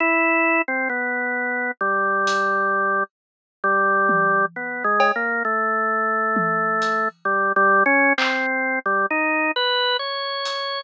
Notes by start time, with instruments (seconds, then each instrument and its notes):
0.00 drawbar organ E4
0.68 drawbar organ C4
0.89 drawbar organ B3
1.81 drawbar organ G3
2.27 closed hi-hat
3.64 drawbar organ G3
4.09 high tom
4.56 drawbar organ B3
4.84 drawbar organ G#3
5.00 cowbell
5.16 drawbar organ A#3
5.45 drawbar organ A3
6.36 high tom
6.82 closed hi-hat
7.25 drawbar organ G3
7.56 drawbar organ G3
7.86 drawbar organ C#4
8.18 drawbar organ C4, clap
8.86 drawbar organ G3
9.10 drawbar organ D#4
9.56 drawbar organ B4
9.99 drawbar organ C#5
10.45 closed hi-hat